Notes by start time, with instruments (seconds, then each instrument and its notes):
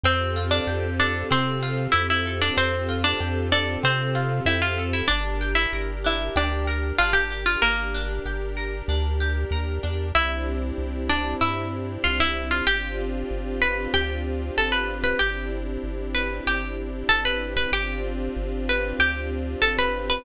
0.03 synth bass 1 F2, orchestral harp C4, string ensemble 1 C4 F4 G4 A4, harpsichord C4 C5
0.36 orchestral harp F4
0.51 harpsichord D4 D5
0.67 synth bass 1 F2, orchestral harp G4
0.99 harpsichord D4 D5, orchestral harp A4
1.31 synth bass 1 C3, orchestral harp C4, harpsichord C4 C5
1.63 orchestral harp F4
1.92 synth bass 1 F2, harpsichord E4 E5, orchestral harp G4
2.10 harpsichord E4 E5
2.26 orchestral harp A4
2.41 harpsichord D4 D5
2.57 synth bass 1 F2, orchestral harp C4, harpsichord C4 C5
2.89 orchestral harp F4
3.04 harpsichord D4 D5
3.20 synth bass 1 F2, orchestral harp G4
3.52 harpsichord D4 D5, orchestral harp A4
3.83 synth bass 1 C3, orchestral harp C4, harpsichord C4 C5
4.15 orchestral harp F4
4.46 synth bass 1 F2, harpsichord E4 E5, orchestral harp G4
4.62 harpsichord F4 F5
4.78 orchestral harp A4
4.93 harpsichord E4 E5
5.08 synth bass 1 G1, harpsichord D4 D5, orchestral harp D4, string ensemble 1 D4 G4 A#4
5.41 orchestral harp G4
5.55 harpsichord E4 E5
5.73 synth bass 1 G1, orchestral harp A#4
6.04 orchestral harp D4, harpsichord E4 E5
6.36 synth bass 1 D2, harpsichord D4 D5, orchestral harp G4
6.67 orchestral harp A#4
6.98 synth bass 1 G1, orchestral harp D4, harpsichord F4 F5
7.13 harpsichord G4 G5
7.30 orchestral harp G4
7.46 harpsichord F4 F5
7.62 synth bass 1 G1, harpsichord A#3 A#4, orchestral harp A#4
7.94 orchestral harp D4
8.25 synth bass 1 G1, orchestral harp G4
8.57 orchestral harp A#4
8.88 synth bass 1 D2, orchestral harp D4
9.20 orchestral harp G4
9.51 synth bass 1 D#2, orchestral harp A#4
9.83 synth bass 1 E2, orchestral harp D4
10.15 synth bass 1 C2, string ensemble 1 C4 D4 E4 G4, harpsichord E4 E5
10.78 synth bass 1 C2
11.09 harpsichord D4 D5
11.41 synth bass 1 G2, harpsichord E4 E5
12.04 synth bass 1 C2, harpsichord F4 F5
12.20 harpsichord E4 E5
12.51 harpsichord F4 F5
12.67 synth bass 1 G1, string ensemble 1 C4 D4 F4 G4, harpsichord G4 G5
13.31 synth bass 1 G1
13.62 harpsichord B4 B5
13.94 synth bass 1 D2, harpsichord G4 G5
14.57 synth bass 1 G1, harpsichord A4 A5
14.72 harpsichord B4 B5
15.04 harpsichord B4 B5
15.19 synth bass 1 G1, string ensemble 1 C4 D4 E4 G4, harpsichord G4 G5
15.84 synth bass 1 G1
16.14 harpsichord B4 B5
16.47 synth bass 1 G1, harpsichord G4 G5
17.09 synth bass 1 G1, harpsichord A4 A5
17.25 harpsichord B4 B5
17.57 harpsichord B4 B5
17.72 synth bass 1 G1, string ensemble 1 C4 D4 F4 G4, harpsichord G4 G5
18.36 synth bass 1 G1
18.69 harpsichord B4 B5
18.99 synth bass 1 D2, harpsichord G4 G5
19.62 synth bass 1 G1, harpsichord A4 A5
19.79 harpsichord B4 B5
20.10 harpsichord B4 B5